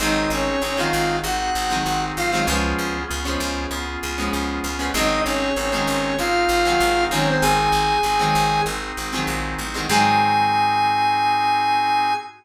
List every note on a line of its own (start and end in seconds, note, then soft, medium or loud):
0.00 0.26 G#1 loud
0.00 0.49 D#3 medium
0.00 0.49 F#3 medium
0.00 0.49 G#3 medium
0.00 0.49 C4 medium
0.00 0.56 C4 medium
0.00 0.56 D#4 loud
0.00 0.29 D#4 medium
0.00 0.56 F#4 medium
0.00 0.56 G#4 medium
0.00 0.29 D#5 loud
0.30 0.57 G#1 medium
0.30 0.62 C#4 medium
0.30 0.62 C#5 medium
0.62 0.88 G#1 medium
0.62 1.18 C4 medium
0.62 0.77 C#4 medium
0.62 1.18 D#4 medium
0.62 1.18 F#4 medium
0.62 1.18 G#4 medium
0.62 0.77 C#5 medium
0.77 1.27 D#3 medium
0.77 1.27 F#3 medium
0.77 1.27 G#3 medium
0.77 1.27 C4 medium
0.77 1.17 F4 medium
0.77 1.17 F5 medium
0.93 1.19 G#1 loud
1.24 1.50 G#1 loud
1.24 1.79 C4 medium
1.24 1.79 D#4 medium
1.24 1.79 F#4 medium
1.24 2.03 F#4 medium
1.24 1.79 G#4 medium
1.24 2.03 F#5 medium
1.55 1.81 G#1 medium
1.70 2.19 D#3 medium
1.70 2.19 F#3 medium
1.70 2.19 G#3 medium
1.70 2.19 C4 medium
1.86 2.12 G#1 medium
1.86 2.41 C4 medium
1.86 2.41 D#4 medium
1.86 2.41 F#4 medium
1.86 2.41 G#4 medium
2.17 2.43 G#1 medium
2.17 2.31 F4 medium
2.17 2.31 F5 medium
2.31 2.45 D#3 medium
2.31 2.45 F#3 medium
2.31 2.45 G#3 medium
2.31 2.45 C4 medium
2.31 2.46 F4 medium
2.31 2.46 F5 medium
2.47 2.74 C#2 loud
2.47 2.97 F3 medium
2.47 2.97 G#3 medium
2.47 3.03 B3 loud
2.47 2.97 B3 medium
2.47 2.97 C#4 medium
2.47 3.03 C#4 loud
2.47 3.03 F4 loud
2.47 3.03 G#4 medium
2.79 3.05 C#2 medium
3.08 3.37 C#2 medium
3.08 3.64 B3 medium
3.08 3.64 C#4 medium
3.08 3.64 F4 medium
3.08 3.64 G#4 medium
3.25 3.75 F3 medium
3.25 3.75 G#3 medium
3.25 3.75 B3 medium
3.25 3.75 C#4 medium
3.40 3.66 C#2 loud
3.71 3.97 C#2 medium
3.71 4.28 B3 medium
3.71 4.28 C#4 medium
3.71 4.28 F4 medium
3.71 4.28 G#4 medium
4.03 4.29 C#2 medium
4.18 4.67 F3 medium
4.18 4.67 G#3 medium
4.18 4.67 B3 medium
4.18 4.67 C#4 medium
4.32 4.60 C#2 medium
4.32 4.88 B3 medium
4.32 4.88 C#4 medium
4.32 4.88 F4 medium
4.32 4.88 G#4 medium
4.64 4.90 C#2 medium
4.79 4.91 F3 medium
4.79 4.91 G#3 medium
4.79 4.91 B3 medium
4.79 4.91 C#4 medium
4.94 5.20 G#1 loud
4.94 5.44 D#3 medium
4.94 5.44 F#3 medium
4.94 5.44 G#3 medium
4.94 5.49 C4 loud
4.94 5.44 C4 medium
4.94 5.49 D#4 loud
4.94 5.21 D#4 loud
4.94 5.49 F#4 loud
4.94 5.49 G#4 loud
4.94 5.21 D#5 loud
5.25 5.52 G#1 medium
5.25 5.55 C#4 medium
5.25 5.55 C#5 medium
5.56 5.83 G#1 medium
5.56 6.13 C4 medium
5.56 5.71 C#4 medium
5.56 6.13 D#4 medium
5.56 6.13 F#4 medium
5.56 6.13 G#4 medium
5.56 5.71 C#5 medium
5.72 6.22 D#3 medium
5.72 6.22 F#3 medium
5.72 6.22 G#3 medium
5.72 6.22 C4 medium
5.72 6.15 C#4 medium
5.72 6.15 C#5 medium
5.87 6.14 G#1 medium
6.18 6.45 G#1 medium
6.18 6.74 C4 medium
6.18 6.74 D#4 medium
6.18 7.04 F4 medium
6.18 6.74 F#4 medium
6.18 6.74 G#4 medium
6.18 7.04 F5 medium
6.49 6.75 G#1 medium
6.65 7.09 D#3 medium
6.65 7.09 F#3 medium
6.65 7.09 G#3 medium
6.65 7.09 C4 medium
6.80 7.07 G#1 loud
6.80 7.36 C4 medium
6.80 7.36 D#4 medium
6.80 7.36 F#4 medium
6.80 7.36 G#4 medium
7.11 7.37 G#1 medium
7.11 7.92 D#3 medium
7.11 7.92 F#3 medium
7.11 7.92 G#3 medium
7.11 7.92 C4 medium
7.11 7.26 C#4 medium
7.11 7.26 C#5 medium
7.28 7.43 C4 medium
7.28 7.43 C5 medium
7.41 7.69 G#1 loud
7.41 7.98 C4 medium
7.41 7.98 D#4 loud
7.41 7.98 F#4 loud
7.41 8.61 G#4 medium
7.41 7.98 G#4 medium
7.41 8.61 G#5 medium
7.72 7.99 G#1 medium
8.03 8.30 G#1 medium
8.03 8.61 C4 medium
8.03 8.61 D#4 medium
8.03 8.61 F#4 medium
8.03 8.61 G#4 medium
8.19 8.69 D#3 medium
8.19 8.69 F#3 medium
8.19 8.69 G#3 medium
8.19 8.69 C4 medium
8.35 8.61 G#1 medium
8.66 8.92 G#1 medium
8.66 9.23 C4 medium
8.66 9.23 D#4 medium
8.66 9.23 F#4 medium
8.66 9.23 G#4 medium
8.97 9.24 G#1 medium
9.13 9.62 D#3 medium
9.13 9.62 F#3 medium
9.13 9.62 G#3 medium
9.13 9.62 C4 medium
9.27 9.55 A#1 medium
9.27 9.83 C4 medium
9.27 9.83 D#4 medium
9.27 9.83 F#4 medium
9.27 9.83 G#4 medium
9.59 9.86 A1 medium
9.74 9.87 D#3 medium
9.74 9.87 F#3 medium
9.74 9.87 G#3 medium
9.74 9.87 C4 medium
9.89 12.12 G#2 loud
9.89 12.12 D#3 loud
9.89 12.12 F#3 loud
9.89 12.12 G#3 loud
9.89 12.12 C4 medium
9.89 12.13 C4 medium
9.89 12.13 D#4 medium
9.89 12.13 F#4 loud
9.89 12.13 G#4 medium
9.89 12.14 G#5 loud